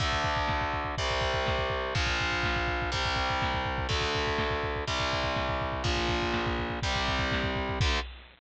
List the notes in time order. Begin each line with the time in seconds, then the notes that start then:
0.00 D2 D3 A3, kick, closed hi-hat
0.12 kick
0.24 kick, closed hi-hat
0.37 kick
0.48 kick, snare
0.61 kick
0.72 kick, closed hi-hat
0.85 kick
0.98 C2 C3 G3, kick, closed hi-hat
1.10 kick
1.21 kick, closed hi-hat
1.34 kick
1.46 kick, snare
1.58 kick
1.70 kick, closed hi-hat
1.94 A#1 A#2 F3, kick, closed hi-hat
2.07 kick
2.20 kick, closed hi-hat
2.32 kick
2.43 kick, snare
2.56 kick
2.67 kick, closed hi-hat
2.82 kick
2.92 C2 C3 G3, kick, closed hi-hat
3.05 kick
3.16 kick, closed hi-hat
3.30 kick
3.42 kick, snare
3.54 kick
3.65 kick, closed hi-hat
3.78 kick
3.89 D2 D3 A3, kick, closed hi-hat
4.01 kick
4.15 kick, closed hi-hat
4.27 kick
4.38 kick, snare
4.51 kick
4.63 kick, closed hi-hat
4.76 kick
4.88 C2 C3 G3, kick, closed hi-hat
5.00 kick
5.13 kick, closed hi-hat
5.24 kick
5.36 kick, snare
5.49 kick
5.60 kick, closed hi-hat
5.72 kick
5.84 A#1 A#2 F3, kick, closed hi-hat
5.96 kick
6.09 kick, closed hi-hat
6.22 kick
6.33 kick, snare
6.47 kick
6.59 kick, closed hi-hat
6.70 kick
6.82 C2 C3 G3, kick, closed hi-hat
6.96 kick
7.07 kick, closed hi-hat
7.19 kick
7.32 kick, snare
7.44 kick
7.55 kick, closed hi-hat
7.69 kick
7.80 D2 D3 A3, kick, crash